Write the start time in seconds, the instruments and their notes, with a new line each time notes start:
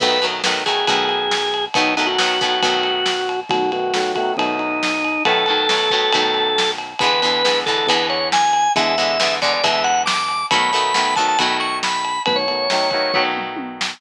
0.00 synth bass 1 B1, acoustic guitar (steel) D#3 F#3 A3 B3, drawbar organ B4, kick, crash
0.22 acoustic guitar (steel) D#3 F#3 A3 B3, ride
0.44 acoustic guitar (steel) D#3 F#3 A3 B3, snare
0.66 acoustic guitar (steel) D#3 F#3 A3 B3, drawbar organ G#4, kick, ride
0.87 synth bass 1 B1, acoustic guitar (steel) D#3 F#3 A3 B3, kick, ride
1.09 ride
1.31 snare
1.54 ride
1.74 synth bass 1 B1, acoustic guitar (steel) D#3 F#3 A3 B3, drawbar organ D#4, kick, ride
1.97 acoustic guitar (steel) D#3 F#3 A3 B3, drawbar organ D#4, ride
2.06 drawbar organ F#4
2.18 acoustic guitar (steel) D#3 F#3 A3 B3, snare
2.41 acoustic guitar (steel) D#3 F#3 A3 B3, kick, ride
2.62 synth bass 1 B1, acoustic guitar (steel) D#3 F#3 A3 B3, kick, ride
2.83 ride
3.06 snare
3.29 ride
3.49 synth bass 1 B1, acoustic guitar (steel) D#3 F#3 A3 B3, drawbar organ F#4, kick, ride
3.72 acoustic guitar (steel) D#3 F#3 A3 B3, drawbar organ F#4, ride
3.94 acoustic guitar (steel) D#3 F#3 A3 B3, snare
4.15 acoustic guitar (steel) D#3 F#3 A3 B3, drawbar organ F#4, kick, ride
4.37 synth bass 1 B1, acoustic guitar (steel) D#3 F#3 A3 B3, drawbar organ D#4, kick, ride
4.59 drawbar organ D#4, ride
4.83 snare
5.04 ride
5.25 synth bass 1 B1, acoustic guitar (steel) D#3 F#3 A3 B3, drawbar organ A4, kick, ride
5.46 acoustic guitar (steel) D#3 F#3 A3 B3, ride
5.69 acoustic guitar (steel) D#3 F#3 A3 B3, snare
5.90 acoustic guitar (steel) D#3 F#3 A3 B3, kick, ride
6.12 synth bass 1 B1, acoustic guitar (steel) D#3 F#3 A3 B3, kick, ride
6.34 ride
6.58 snare
6.78 ride
6.99 synth bass 1 E2, acoustic guitar (steel) E3 G#3 B3, drawbar organ B4, kick, ride
7.03 acoustic guitar (steel) D3
7.22 acoustic guitar (steel) D3 E3 G#3 B3, ride
7.45 acoustic guitar (steel) D3 E3 G#3 B3, snare
7.66 acoustic guitar (steel) D3 E3 G#3 B3, drawbar organ A4, kick, ride
7.78 drawbar organ A4
7.87 synth bass 1 E2, acoustic guitar (steel) E3 G#3 B3, drawbar organ B4, kick, ride
7.91 acoustic guitar (steel) D3
8.10 drawbar organ C#5, ride
8.32 drawbar organ G#5, snare
8.53 ride
8.75 synth bass 1 E2, acoustic guitar (steel) D3 E3 G#3 B3, drawbar organ E5, kick, ride
8.98 acoustic guitar (steel) D3 E3 G#3 B3, ride
9.20 acoustic guitar (steel) D3 E3 G#3 B3, snare
9.42 acoustic guitar (steel) D3 E3 G#3 B3, drawbar organ D5, kick, ride
9.53 drawbar organ D5
9.64 synth bass 1 E2, acoustic guitar (steel) D3 E3 G#3 B3, drawbar organ E5, kick, ride
9.84 drawbar organ F#5, ride
10.06 drawbar organ D6, snare
10.28 ride
10.51 synth bass 1 B1, acoustic guitar (steel) D#3 F#3 A3 B3, drawbar organ B5, kick, ride
10.73 acoustic guitar (steel) D#3 F#3 A3 B3, ride
10.94 acoustic guitar (steel) D#3 F#3 A3 B3, snare
11.16 acoustic guitar (steel) D#3 F#3 A3 B3, drawbar organ A5, kick, ride
11.28 drawbar organ A5
11.38 synth bass 1 B1, acoustic guitar (steel) D#3 F#3 A3 B3, drawbar organ B5, kick, ride
11.60 drawbar organ C#6, ride
11.83 drawbar organ B5, snare
12.05 ride
12.26 synth bass 1 B1, acoustic guitar (steel) D#3 F#3 A3 B3, drawbar organ B4, kick, ride
12.36 drawbar organ C#5
12.48 acoustic guitar (steel) D#3 F#3 A3 B3, ride
12.70 acoustic guitar (steel) D#3 F#3 A3 B3, snare
12.91 acoustic guitar (steel) D#3 F#3 A3 B3, kick, ride
13.14 synth bass 1 B1, acoustic guitar (steel) D#3 F#3 A3 B3, kick, floor tom
13.37 mid tom
13.57 high tom
13.81 snare